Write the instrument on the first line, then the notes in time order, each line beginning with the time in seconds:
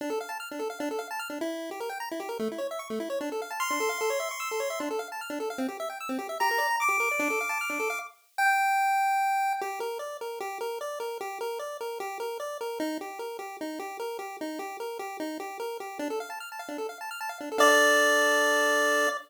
lead 1 (square)
0.01 D4
0.10 A4
0.21 F5
0.29 A5
0.40 F6
0.51 D4
0.59 A4
0.70 F5
0.80 D4
0.91 A4
0.99 F5
1.11 A5
1.19 F6
1.30 D4
1.41 E4
1.71 G4
1.80 A#4
1.90 G5
2.00 A#5
2.11 E4
2.20 G4
2.29 A#4
2.39 A3
2.52 E4
2.58 C#5
2.71 E5
2.79 C#6
2.90 A3
3.00 E4
3.10 C#5
3.21 D4
3.32 A4
3.42 F5
3.51 A5
3.60 C6 F6
3.70 D4
3.80 A4
3.89 F5
4.01 A4
4.10 C#5
4.20 E5
4.31 C#6
4.40 E6
4.51 A4
4.60 C#5
4.70 E5
4.80 D4
4.91 A4
4.99 F5
5.12 A5
5.21 F6
5.30 D4
5.40 A4
5.50 F5
5.58 C4
5.68 G4
5.80 E5
5.90 G5
6.01 E6
6.09 C4
6.19 G4
6.29 E5
6.40 G4 A#5
6.51 A#4
6.58 D5
6.71 A#5
6.80 D6
6.89 G4
7.00 A#4
7.11 D5
7.19 D4
7.30 A4
7.41 F5
7.49 A5
7.61 F6
7.70 D4
7.80 A4
7.90 F5
8.38 G5
9.61 G4
9.80 A#4
9.99 D5
10.21 A#4
10.40 G4
10.61 A#4
10.81 D5
11.00 A#4
11.21 G4
11.41 A#4
11.59 D5
11.81 A#4
12.00 G4
12.20 A#4
12.40 D5
12.61 A#4
12.80 D#4
13.01 G4
13.19 A#4
13.39 G4
13.61 D#4
13.79 G4
14.00 A#4
14.19 G4
14.41 D#4
14.59 G4
14.80 A#4
14.99 G4
15.20 D#4
15.40 G4
15.60 A#4
15.80 G4
15.99 D4
16.10 A4
16.20 F5
16.30 A5
16.40 F6
16.52 A5
16.59 F5
16.69 D4
16.78 A4
16.89 F5
17.01 A5
17.11 F6
17.21 A5
17.29 F5
17.41 D4
17.52 A4
17.58 D4 A4 D5 F5